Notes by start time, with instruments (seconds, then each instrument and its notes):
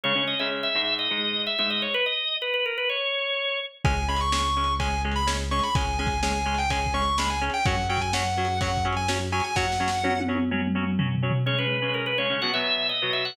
0.03 acoustic guitar (steel) C#3 G#3 C#4, drawbar organ C#5
0.16 acoustic guitar (steel) C#3 G#3 C#4
0.27 drawbar organ D#5
0.39 acoustic guitar (steel) C#3 G#3 C#4, drawbar organ E5
0.63 drawbar organ E5
0.75 acoustic guitar (steel) G#2 G#3 D#4
0.99 drawbar organ D#5
1.11 acoustic guitar (steel) G#2 G#3 D#4
1.47 drawbar organ E5
1.58 acoustic guitar (steel) G#2 G#3 D#4, drawbar organ E5
1.70 drawbar organ D#5
1.82 drawbar organ C#5
1.94 drawbar organ B4
2.06 drawbar organ D#5
2.42 drawbar organ B4
2.54 drawbar organ B4
2.66 drawbar organ A#4
2.78 drawbar organ B4
2.89 drawbar organ C#5
3.85 synth bass 1 C#2, acoustic guitar (steel) G#3 C#4, distortion guitar G#5, kick, ride
4.08 acoustic guitar (steel) G#3 C#4, distortion guitar B5
4.16 distortion guitar C#6, ride
4.32 acoustic guitar (steel) G#3 C#4, distortion guitar C#6, snare
4.57 acoustic guitar (steel) G#3 C#4
4.64 ride
4.79 acoustic guitar (steel) G#3 C#4, distortion guitar G#5, kick, ride
5.04 acoustic guitar (steel) G#3 C#4
5.12 ride
5.16 distortion guitar B5
5.27 acoustic guitar (steel) G#3 C#4, snare
5.51 acoustic guitar (steel) G#3 C#4, distortion guitar C#6
5.59 distortion guitar B5, ride
5.75 synth bass 1 C#2, acoustic guitar (steel) G#3 C#4, distortion guitar G#5, kick, ride
5.99 acoustic guitar (steel) G#3 C#4, distortion guitar G#5
6.07 kick, ride
6.23 acoustic guitar (steel) G#3 C#4, distortion guitar G#5, snare
6.46 acoustic guitar (steel) G#3 C#4
6.54 distortion guitar G5, ride
6.70 acoustic guitar (steel) G#3 C#4, distortion guitar G#5, kick, ride
6.86 kick
6.94 acoustic guitar (steel) G#3 C#4, distortion guitar C#6
7.02 ride
7.18 acoustic guitar (steel) G#3 C#4, distortion guitar B5, snare
7.30 distortion guitar G#5
7.41 acoustic guitar (steel) G#3 C#4
7.50 distortion guitar G5, ride
7.65 synth bass 1 F#2, acoustic guitar (steel) F#3 C#4, distortion guitar F#5, kick, ride
7.89 acoustic guitar (steel) F#3 C#4, distortion guitar G5
7.97 kick, ride
8.01 distortion guitar G#5
8.13 acoustic guitar (steel) F#3 C#4, distortion guitar F#5, snare
8.37 acoustic guitar (steel) F#3 C#4
8.45 ride
8.61 acoustic guitar (steel) F#3 C#4, distortion guitar F#5, kick, ride
8.77 kick
8.85 acoustic guitar (steel) F#3 C#4
8.93 distortion guitar G#5, ride
9.08 acoustic guitar (steel) F#3 C#4, snare
9.32 acoustic guitar (steel) F#3 C#4, distortion guitar G#5
9.40 distortion guitar G#5, ride
9.55 synth bass 1 F#2, acoustic guitar (steel) F#3 C#4, distortion guitar F#5, kick, snare
9.72 snare
9.80 acoustic guitar (steel) F#3 C#4
9.88 snare
10.04 acoustic guitar (steel) F#3 C#4, high tom
10.20 high tom
10.28 acoustic guitar (steel) F#3 C#4
10.35 high tom
10.51 acoustic guitar (steel) F#3 C#4, mid tom
10.67 mid tom
10.75 acoustic guitar (steel) F#3 C#4
10.83 mid tom
10.99 acoustic guitar (steel) F#3 C#4, floor tom
11.15 floor tom
11.23 acoustic guitar (steel) F#3 C#4
11.31 floor tom
11.46 acoustic guitar (steel) C#3 G#3 C#4, drawbar organ C#5
11.58 acoustic guitar (steel) C#3 G#3 C#4, drawbar organ B4
11.82 acoustic guitar (steel) C#3 G#3 C#4
11.94 drawbar organ A#4
12.06 drawbar organ B4
12.18 acoustic guitar (steel) C#3 G#3 C#4, drawbar organ C#5
12.30 acoustic guitar (steel) C#3 G#3 C#4
12.42 acoustic guitar (steel) B2 F#3 B3, drawbar organ F#5
12.54 acoustic guitar (steel) B2 F#3 B3, drawbar organ E5
12.89 drawbar organ D#5
13.02 acoustic guitar (steel) B2 F#3 B3
13.13 drawbar organ E5
13.25 drawbar organ F#5